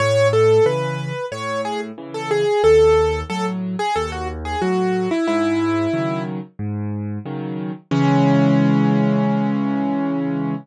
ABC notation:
X:1
M:4/4
L:1/16
Q:1/4=91
K:C#m
V:1 name="Acoustic Grand Piano"
c2 A2 B4 c2 G z2 A G2 | A4 A z2 G A F z G F3 E | E6 z10 | C16 |]
V:2 name="Acoustic Grand Piano" clef=bass
A,,4 [C,E,]4 A,,4 [C,E,]4 | D,,4 [A,,F,]4 D,,4 [A,,F,]4 | G,,4 [C,D,F,]4 G,,4 [C,D,F,]4 | [C,E,G,]16 |]